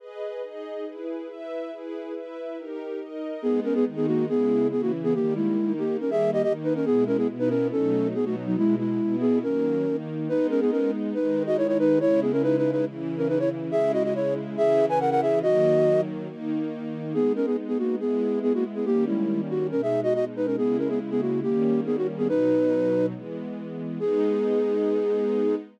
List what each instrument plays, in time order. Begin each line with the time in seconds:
0.00 string ensemble 1 G#4 B4 D#5
0.42 string ensemble 1 D#4 G#4 D#5
0.86 string ensemble 1 E4 G#4 B4
1.29 string ensemble 1 E4 B4 E5
1.71 string ensemble 1 E4 G#4 B4
2.15 string ensemble 1 E4 B4 E5
2.57 string ensemble 1 D#4 G4 A#4
3.00 string ensemble 1 D#4 A#4 D#5
3.42 string ensemble 1 G#3 B3 D#4, flute B3 G#4
3.64 flute C#4 A#4
3.75 flute B3 G#4
3.86 string ensemble 1 D#3 G#3 D#4
3.96 flute B3 G#4
4.07 flute A#3 F#4
4.29 string ensemble 1 C#3 G#3 E4, flute B3 G#4
4.71 string ensemble 1 C#3 E3 E4, flute B3 G#4
4.82 flute A#3 F#4
5.04 flute B3 G#4
5.14 string ensemble 1 D#3 G3 A#3, flute A#3 G4
5.36 flute G#3 E4
5.58 string ensemble 1 D#3 A#3 D#4
5.78 flute A#3 G4
6.00 string ensemble 1 D#3 G3 A#3, flute C#4 A#4
6.11 flute G#4 E5
6.33 flute G4 D#5
6.43 string ensemble 1 D#3 A#3 D#4, flute G4 D#5
6.64 flute D#4 B4
6.75 flute C#4 A#4
6.85 string ensemble 1 B2 G#3 E4, flute B3 G#4
7.07 flute C#4 A#4
7.17 flute B3 G#4
7.29 string ensemble 1 B2 B3 E4
7.39 flute D#4 B4
7.49 flute C#4 A#4
7.72 string ensemble 1 B2 F#3 A3 D#4, flute C#4 A4
8.15 string ensemble 1 B2 F#3 B3 D#4, flute B3 G#4
8.25 flute A3 F#4
8.46 flute F#3 D#4
8.57 string ensemble 1 B2 G#3 E4, flute G#3 E4
8.79 flute G#3 E4
9.00 string ensemble 1 B2 B3 E4
9.21 flute B3 G#4
9.43 string ensemble 1 D#3 F#3 A#3, flute C#4 A#4
9.85 string ensemble 1 D#3 A#3 D#4
10.28 string ensemble 1 G#3 B3 D#4, flute D#4 B4
10.50 flute C#4 A#4
10.61 flute B3 G#4
10.71 flute C#4 A#4
11.14 string ensemble 1 D#3 G#3 D#4, flute D#4 B4
11.46 flute F#4 D#5
11.57 flute E4 C#5
11.68 flute E4 C#5
11.79 flute D#4 B4
12.00 string ensemble 1 C#3 G#3 E4, flute E4 C#5
12.22 flute B3 G#4
12.32 flute C#4 A#4
12.43 flute D#4 B4
12.57 flute D#4 B4
12.72 flute D#4 B4
12.86 string ensemble 1 C#3 E3 E4
13.17 flute C#4 A#4
13.28 flute D#4 B4
13.39 flute E4 C#5
13.71 string ensemble 1 C#3 G#3 E4, flute G#4 E5
13.93 flute F#4 D#5
14.04 flute F#4 D#5
14.15 flute E4 C#5
14.57 string ensemble 1 C#3 E3 E4, flute G#4 E5
14.89 flute B4 G#5
15.00 flute A#4 F#5
15.11 flute A#4 F#5
15.22 flute G#4 E5
15.42 string ensemble 1 D#3 F#3 A#3, flute F#4 D#5
16.29 string ensemble 1 D#3 A#3 D#4
17.14 string ensemble 1 G#3 B3 D#4, flute B3 G#4
17.36 flute C#4 A#4
17.46 flute B3 G#4
17.68 flute B3 G#4
17.78 flute A#3 F#4
18.00 string ensemble 1 G#3 B3 E4, flute B3 G#4
18.43 flute B3 G#4
18.54 flute A#3 F#4
18.75 flute B3 G#4
18.85 string ensemble 1 D#3 G3 A#3 C#4, flute A#3 G4
19.07 flute G#3 E4
19.50 flute F#4
19.71 string ensemble 1 B2 G#3 D#4, flute C#4 A#4
19.82 flute G#4 E5
20.03 flute F#4 D#5
20.15 flute F#4 D#5
20.36 flute D#4 B4
20.46 flute C#4 A#4
20.57 string ensemble 1 C#3 G#3 E4, flute B3 G#4
20.78 flute C#4 A#4
20.89 flute B3 G#4
21.11 flute B3 G#4
21.21 flute A#3 F#4
21.43 string ensemble 1 D#3 G3 A#3 C#4, flute A#3 G4
21.86 flute B3 G#4
21.97 flute F#4
22.18 flute B3 G#4
22.29 string ensemble 1 B2 F#3 D#4, flute D#4 B4
23.14 string ensemble 1 E3 G#3 B3
24.00 string ensemble 1 G#3 B3 D#4, flute G#4